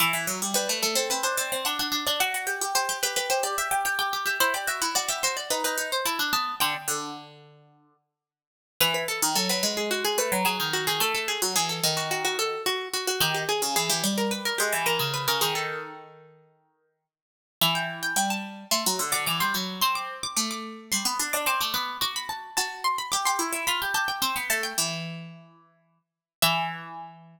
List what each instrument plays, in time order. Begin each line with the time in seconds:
0.00 pizzicato strings E3, harpsichord E5
0.13 pizzicato strings E3
0.27 pizzicato strings F#3
0.42 pizzicato strings G3
0.54 pizzicato strings G3, harpsichord B4
0.69 pizzicato strings A3
0.83 pizzicato strings A3, harpsichord A4
0.95 pizzicato strings C4, harpsichord A4
1.10 pizzicato strings C4, harpsichord B4
1.23 pizzicato strings D4, harpsichord C5
1.37 pizzicato strings C4, harpsichord D5
1.52 pizzicato strings C4
1.65 pizzicato strings D4, harpsichord F#5
1.79 pizzicato strings D4, harpsichord F#5
1.92 pizzicato strings D4
2.07 pizzicato strings D4, harpsichord D5
2.20 pizzicato strings F#4, harpsichord F#5
2.34 pizzicato strings F#4
2.47 pizzicato strings G4
2.61 pizzicato strings G4
2.75 pizzicato strings G4, harpsichord C5
2.89 pizzicato strings G4
3.03 pizzicato strings G4, harpsichord B4
3.16 pizzicato strings G4, harpsichord B4
3.30 pizzicato strings G4, harpsichord C5
3.43 pizzicato strings G4, harpsichord D5
3.58 pizzicato strings G4, harpsichord E5
3.71 pizzicato strings G4
3.85 pizzicato strings G4, harpsichord G5
3.99 pizzicato strings G4, harpsichord G5
4.13 pizzicato strings G4
4.26 pizzicato strings G4, harpsichord E5
4.40 pizzicato strings E4, harpsichord C5
4.54 pizzicato strings G4, harpsichord D5
4.67 pizzicato strings F#4, harpsichord E5
4.82 pizzicato strings E4, harpsichord F#5
4.95 pizzicato strings F#4, harpsichord D5
5.08 pizzicato strings G4, harpsichord E5
5.23 pizzicato strings F#4, harpsichord C5
5.37 harpsichord D5
5.50 pizzicato strings D#4, harpsichord B4
5.64 pizzicato strings D#4, harpsichord B4
5.78 pizzicato strings D#4
5.92 harpsichord C5
6.06 pizzicato strings E4, harpsichord A5
6.19 pizzicato strings D4
6.33 pizzicato strings B3, harpsichord A5
6.60 pizzicato strings D3, harpsichord G5
6.88 pizzicato strings D3
8.81 pizzicato strings E3, harpsichord B4
8.94 harpsichord B4
9.08 harpsichord A4
9.22 pizzicato strings D#3
9.35 pizzicato strings F#3, harpsichord A4
9.49 pizzicato strings F#3, harpsichord B4
9.63 pizzicato strings G#3
9.77 harpsichord G#4
9.91 harpsichord F#4
10.05 harpsichord G#4
10.18 pizzicato strings A3, harpsichord B4
10.32 pizzicato strings F#3
10.45 pizzicato strings F#3, harpsichord G#4
10.60 pizzicato strings D#3
10.73 harpsichord F#4
10.87 pizzicato strings D#3, harpsichord G#4
11.00 pizzicato strings A3, harpsichord A4
11.15 harpsichord A4
11.28 harpsichord G#4
11.42 pizzicato strings F#3
11.56 pizzicato strings E3, harpsichord G#4
11.69 harpsichord A4
11.83 pizzicato strings D#3
11.97 harpsichord F#4
12.11 harpsichord F#4
12.25 harpsichord F#4
12.39 harpsichord A4
12.66 harpsichord F#4
12.93 harpsichord F#4
13.07 harpsichord F#4
13.20 pizzicato strings D#3, harpsichord G4
13.35 harpsichord G4
13.49 harpsichord G#4
13.62 pizzicato strings C#3
13.76 pizzicato strings E3, harpsichord G#4
13.90 pizzicato strings E3, harpsichord G4
14.04 pizzicato strings G3
14.18 harpsichord A#4
14.31 harpsichord B4
14.45 harpsichord A#4
14.58 pizzicato strings G#3, harpsichord G4
14.72 pizzicato strings E3
14.86 pizzicato strings E3, harpsichord A#4
14.99 pizzicato strings C#3
15.14 harpsichord B4
15.28 pizzicato strings C#3, harpsichord A#4
15.41 pizzicato strings D#3, harpsichord G#4
15.55 harpsichord A4
17.61 pizzicato strings E3, harpsichord E5
17.75 harpsichord G5
18.03 harpsichord G5
18.16 pizzicato strings G3, harpsichord G5
18.30 harpsichord A5
18.71 pizzicato strings A3, harpsichord C6
18.86 pizzicato strings F#3
18.99 pizzicato strings D3
19.12 pizzicato strings D3, harpsichord D6
19.26 pizzicato strings E3, harpsichord D6
19.40 pizzicato strings G3, harpsichord C6
19.54 pizzicato strings F#3, harpsichord B5
19.81 pizzicato strings C4, harpsichord C6
19.95 harpsichord D6
20.23 harpsichord D6
20.36 pizzicato strings A3, harpsichord D6
20.51 harpsichord D6
20.92 pizzicato strings G3, harpsichord C6
21.05 pizzicato strings B3
21.19 pizzicato strings D4
21.33 pizzicato strings D4, harpsichord D6
21.46 pizzicato strings C4, harpsichord D6
21.61 pizzicato strings A3, harpsichord D6
21.74 pizzicato strings B3, harpsichord D6
22.01 pizzicato strings F#4, harpsichord D6
22.16 harpsichord B5
22.29 harpsichord A5
22.57 pizzicato strings F#4, harpsichord A5
22.84 harpsichord C6
22.98 harpsichord B5
23.12 pizzicato strings G4, harpsichord D6
23.25 pizzicato strings G4, harpsichord C6
23.39 pizzicato strings E4
23.53 pizzicato strings E4
23.67 pizzicato strings F4, harpsichord B5
23.82 pizzicato strings G4
23.94 pizzicato strings G4, harpsichord A5
24.08 harpsichord G5
24.22 pizzicato strings C4, harpsichord G5
24.36 pizzicato strings B3
24.50 pizzicato strings A3, harpsichord A5
24.63 harpsichord G5
24.78 pizzicato strings E3
26.42 pizzicato strings E3, harpsichord E5